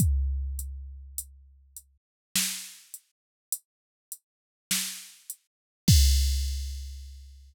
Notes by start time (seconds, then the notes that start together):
0.00 kick, closed hi-hat
0.59 closed hi-hat
1.18 closed hi-hat
1.76 closed hi-hat
2.36 snare
2.94 closed hi-hat
3.52 closed hi-hat
4.12 closed hi-hat
4.71 snare
5.30 closed hi-hat
5.88 kick, crash